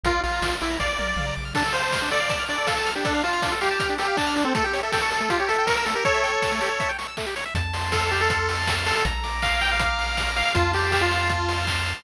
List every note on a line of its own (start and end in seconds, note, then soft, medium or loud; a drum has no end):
0.03 0.19 A#1 medium
0.03 0.21 F4 loud
0.03 0.13 A#4 medium
0.03 kick medium
0.03 closed hi-hat medium
0.14 0.23 D5 soft
0.23 0.40 A#1 medium
0.23 0.56 F4 medium
0.23 0.32 F5 medium
0.23 open hi-hat medium
0.33 0.41 A#5 medium
0.42 0.58 A#1 medium
0.42 0.51 D6 medium
0.42 kick medium
0.42 snare medium
0.52 0.60 F6 soft
0.61 0.78 A#1 medium
0.61 0.77 E4 medium
0.61 0.69 D6 medium
0.61 open hi-hat medium
0.70 0.79 A#5 medium
0.80 0.97 A#1 medium
0.80 1.34 D5 medium
0.80 0.88 F5 medium
0.80 kick medium
0.80 snare medium
0.89 0.97 D5 medium
0.99 1.15 A#1 medium
0.99 1.07 A#4 medium
0.99 high tom medium
1.08 1.16 D5 medium
1.16 1.32 A#1 medium
1.16 1.26 F5 medium
1.16 mid tom medium
1.26 1.35 A#5 medium
1.36 1.53 A#1 medium
1.36 1.45 D6 medium
1.45 1.53 F6 medium
1.54 1.63 D4 loud
1.54 1.73 A4 medium
1.54 kick medium
1.54 crash medium
1.64 1.73 A4 medium
1.64 closed hi-hat medium
1.73 2.09 C5 medium
1.73 1.82 F5 medium
1.73 open hi-hat medium
1.83 1.91 A5 medium
1.83 closed hi-hat medium
1.92 2.01 F6 medium
1.92 kick medium
1.92 snare medium
2.02 2.10 D4 medium
2.02 closed hi-hat medium
2.11 2.20 A4 medium
2.11 2.44 D5 loud
2.11 open hi-hat medium
2.20 2.29 F5 medium
2.20 closed hi-hat medium
2.29 2.38 A5 medium
2.29 kick medium
2.29 closed hi-hat medium
2.39 2.48 F6 medium
2.39 closed hi-hat medium
2.48 2.57 D4 medium
2.48 2.67 D5 medium
2.48 open hi-hat medium
2.58 2.66 A4 medium
2.58 closed hi-hat medium
2.66 2.91 A4 medium
2.66 2.75 F5 medium
2.66 kick medium
2.66 snare medium
2.77 2.85 A5 medium
2.77 closed hi-hat medium
2.86 2.94 F6 medium
2.86 open hi-hat medium
2.95 3.04 D4 medium
2.95 3.04 G4 medium
2.95 closed hi-hat medium
3.04 3.22 D4 loud
3.04 3.13 A4 loud
3.04 kick medium
3.04 closed hi-hat medium
3.14 3.23 F5 medium
3.14 closed hi-hat medium
3.23 3.54 F4 loud
3.23 3.32 A5 medium
3.23 open hi-hat medium
3.33 3.41 F6 medium
3.33 closed hi-hat medium
3.42 3.51 D4 medium
3.42 kick medium
3.42 snare medium
3.52 3.60 A4 loud
3.52 closed hi-hat medium
3.61 3.95 G4 loud
3.61 3.69 F5 medium
3.61 open hi-hat medium
3.70 3.79 A5 medium
3.70 closed hi-hat medium
3.79 3.88 F6 loud
3.79 kick medium
3.79 closed hi-hat medium
3.89 3.98 D4 medium
3.89 closed hi-hat medium
3.98 4.17 G4 loud
3.98 4.07 A4 medium
3.98 open hi-hat medium
4.08 4.16 F5 medium
4.08 closed hi-hat medium
4.17 4.44 D4 medium
4.17 4.26 A5 loud
4.17 kick medium
4.17 clap medium
4.26 4.35 F6 medium
4.26 closed hi-hat medium
4.36 4.44 D4 medium
4.36 open hi-hat medium
4.44 4.53 C4 loud
4.44 4.53 A4 medium
4.44 closed hi-hat medium
4.54 4.63 A3 loud
4.54 4.64 A4 loud
4.54 kick medium
4.54 closed hi-hat medium
4.64 4.73 G4 loud
4.64 4.80 G4 medium
4.64 closed hi-hat medium
4.73 4.82 C#5 loud
4.73 open hi-hat medium
4.83 4.92 A4 medium
4.83 4.91 E5 medium
4.83 closed hi-hat medium
4.92 5.01 A4 medium
4.92 5.01 G5 loud
4.92 kick medium
4.92 snare loud
5.01 5.10 A4 medium
5.01 5.10 C#6 medium
5.01 closed hi-hat medium
5.11 5.20 A4 medium
5.11 5.20 E6 medium
5.11 open hi-hat medium
5.20 5.29 A3 medium
5.20 5.30 A4 medium
5.20 closed hi-hat medium
5.30 5.39 F4 loud
5.30 5.38 G4 loud
5.30 kick medium
5.30 closed hi-hat medium
5.39 5.49 G4 medium
5.39 5.48 C#5 medium
5.39 closed hi-hat soft
5.48 5.66 A4 loud
5.48 5.57 E5 medium
5.48 open hi-hat medium
5.58 5.67 G5 medium
5.58 closed hi-hat medium
5.67 5.76 A#4 loud
5.67 5.76 C#6 medium
5.67 kick medium
5.67 snare medium
5.76 5.85 A#4 medium
5.76 5.85 E6 medium
5.76 closed hi-hat medium
5.85 5.94 A3 medium
5.85 5.94 A4 medium
5.85 open hi-hat medium
5.95 6.04 G4 medium
5.95 6.04 A#4 medium
5.95 closed hi-hat medium
6.05 6.91 A4 medium
6.05 6.13 C#5 loud
6.05 6.91 C#5 loud
6.05 kick medium
6.05 closed hi-hat medium
6.14 6.23 E5 medium
6.14 closed hi-hat medium
6.23 6.32 G5 medium
6.23 open hi-hat medium
6.33 6.42 C#6 medium
6.33 closed hi-hat medium
6.42 6.51 E6 loud
6.42 kick medium
6.42 snare medium
6.52 6.60 A3 medium
6.52 closed hi-hat medium
6.61 6.69 G4 medium
6.61 open hi-hat medium
6.70 6.79 C#5 medium
6.70 closed hi-hat medium
6.80 6.88 E5 medium
6.80 kick medium
6.80 closed hi-hat medium
6.89 6.97 G5 medium
6.89 closed hi-hat medium
6.98 7.07 C#6 medium
6.98 open hi-hat medium
7.08 7.16 E6 medium
7.08 closed hi-hat medium
7.17 7.26 A3 medium
7.17 kick medium
7.17 clap medium
7.26 7.35 G4 medium
7.26 closed hi-hat medium
7.36 7.44 C#5 medium
7.36 open hi-hat medium
7.45 7.54 E5 medium
7.45 closed hi-hat medium
7.55 8.93 F2 medium
7.55 8.30 A5 medium
7.55 kick medium
7.55 closed hi-hat medium
7.73 8.11 C6 medium
7.73 open hi-hat medium
7.92 8.10 A4 loud
7.92 8.67 F6 medium
7.92 kick medium
7.92 snare medium
8.11 8.20 G4 medium
8.11 8.48 C6 medium
8.11 open hi-hat medium
8.21 8.75 A4 loud
8.30 9.01 A5 medium
8.30 kick medium
8.30 closed hi-hat loud
8.49 8.85 C6 medium
8.49 open hi-hat medium
8.67 9.03 F6 medium
8.67 kick medium
8.67 snare loud
8.86 8.95 A4 loud
8.86 9.04 C6 medium
8.86 open hi-hat medium
8.95 9.04 A4 medium
9.04 10.43 A#1 medium
9.04 9.80 A#5 medium
9.04 kick medium
9.04 closed hi-hat medium
9.24 9.61 D6 medium
9.24 open hi-hat medium
9.42 9.60 F5 loud
9.42 10.17 F6 medium
9.42 kick medium
9.42 clap medium
9.61 9.70 G5 loud
9.61 9.98 D6 medium
9.61 open hi-hat medium
9.71 10.31 F5 medium
9.79 10.51 A#5 medium
9.79 kick medium
9.79 closed hi-hat loud
9.98 10.35 D6 medium
9.98 open hi-hat medium
10.17 10.53 F6 medium
10.17 kick medium
10.17 snare medium
10.36 10.45 F5 loud
10.36 10.54 D6 medium
10.36 open hi-hat medium
10.45 10.54 F5 medium
10.54 11.94 F2 loud
10.54 10.72 F4 loud
10.54 11.29 A5 medium
10.54 kick medium
10.54 closed hi-hat medium
10.73 10.91 G4 loud
10.73 11.10 C6 medium
10.73 open hi-hat medium
10.92 11.01 G4 loud
10.92 11.67 F6 medium
10.92 kick medium
10.92 clap medium
11.01 11.65 F4 loud
11.11 11.48 C6 medium
11.11 open hi-hat medium
11.29 12.01 A5 medium
11.29 kick medium
11.29 closed hi-hat medium
11.49 11.86 C6 medium
11.49 open hi-hat medium
11.67 12.03 F6 medium
11.67 kick medium
11.67 clap loud
11.86 12.04 C6 medium
11.86 open hi-hat medium